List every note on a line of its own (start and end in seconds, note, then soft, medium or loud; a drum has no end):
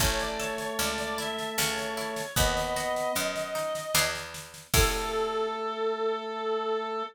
0.00 0.71 A1 medium
0.00 2.22 A3 loud
0.00 0.78 C#4 loud
0.00 0.19 C#5 medium
0.00 kick medium
0.00 snare medium
0.19 0.39 D5 medium
0.19 snare medium
0.39 1.52 A4 medium
0.39 0.58 C#5 medium
0.39 snare medium
0.58 0.78 C#5 medium
0.58 snare medium
0.79 1.50 C#2 medium
0.79 1.54 C#4 medium
0.79 0.98 D5 medium
0.79 snare medium
0.98 1.18 D5 medium
0.98 snare medium
1.18 1.56 E4 medium
1.18 1.55 E5 medium
1.18 snare medium
1.38 snare medium
1.58 2.31 C#2 medium
1.58 2.33 C#4 loud
1.58 2.32 C#5 medium
1.58 snare medium
1.78 snare medium
1.97 2.35 E4 medium
1.97 snare medium
2.16 snare medium
2.36 3.08 D#2 medium
2.36 3.16 B3 loud
2.36 3.12 B3 loud
2.36 4.10 D#5 medium
2.36 kick medium
2.36 snare medium
2.57 snare medium
2.76 3.89 F#4 medium
2.76 snare medium
2.96 snare medium
3.15 3.87 F#2 medium
3.15 3.91 B3 medium
3.15 snare medium
3.36 snare medium
3.55 3.93 D#4 medium
3.55 snare medium
3.75 snare medium
3.94 4.67 E2 medium
3.94 4.66 B3 loud
3.94 4.66 D4 loud
3.94 4.66 E4 loud
3.94 4.66 G#4 loud
3.94 snare loud
4.15 snare medium
4.34 snare medium
4.54 snare medium
4.74 7.03 A2 loud
4.74 7.03 A3 loud
4.74 7.03 C#4 loud
4.74 7.03 E4 loud
4.74 7.03 A4 loud
4.74 kick loud
4.74 crash loud